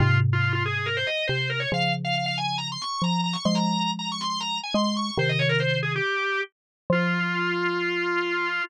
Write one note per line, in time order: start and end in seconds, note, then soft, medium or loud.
0.00 1.04 G#2 medium
0.00 1.04 C3 medium
0.00 0.18 F4 loud
0.33 0.43 F4 medium
0.43 0.52 F4 medium
0.53 0.63 F4 medium
0.66 0.87 G#4 medium
0.86 0.96 A#4 medium
0.97 1.07 C5 loud
1.07 1.26 D#5 medium
1.27 1.66 C3 medium
1.27 1.48 C5 medium
1.50 1.60 A#4 medium
1.60 1.70 C#5 medium
1.72 2.78 C#3 medium
1.72 2.78 F3 medium
1.72 1.92 F5 loud
2.05 2.15 F5 medium
2.15 2.25 F5 medium
2.26 2.36 F5 loud
2.38 2.57 G#5 medium
2.58 2.68 A#5 loud
2.72 2.82 C6 medium
2.82 3.02 C#6 medium
3.02 3.37 F3 medium
3.02 3.21 A#5 medium
3.24 3.34 A#5 medium
3.33 3.43 C#6 medium
3.45 4.60 F3 medium
3.45 4.60 G#3 medium
3.45 3.55 C6 loud
3.55 3.91 A#5 medium
3.99 4.09 A#5 medium
4.12 4.22 C#6 medium
4.21 4.29 C6 medium
4.30 4.40 C6 loud
4.40 4.59 A#5 loud
4.63 4.74 G#5 medium
4.74 5.11 G#3 medium
4.74 4.84 C6 medium
4.84 4.94 C6 medium
4.97 5.15 C#6 medium
5.18 6.00 C3 medium
5.18 6.00 D#3 medium
5.18 5.29 C5 loud
5.29 5.39 D#5 loud
5.39 5.49 C#5 medium
5.49 5.59 A#4 loud
5.60 5.79 C5 medium
5.83 5.93 G#4 medium
5.96 6.41 G4 loud
6.90 8.60 F3 loud
6.90 8.63 F4 loud